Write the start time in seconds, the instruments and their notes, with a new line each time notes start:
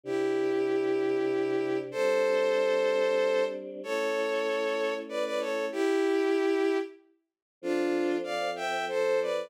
0.04 choir aahs C3 D4 G4, violin E4 G4
1.91 choir aahs G3 C4 D4, violin A4 C5
3.83 choir aahs A3 C#4 E4, violin A4 C#5
5.09 violin B4 D5
5.25 violin B4 D5
5.40 violin A4 C#5
5.72 violin E4 G4
7.62 choir aahs F3 C4 A4, violin D4 F4
8.24 violin D5 F5
8.56 violin E5 G5
8.89 violin A4 C5
9.22 violin B4 D5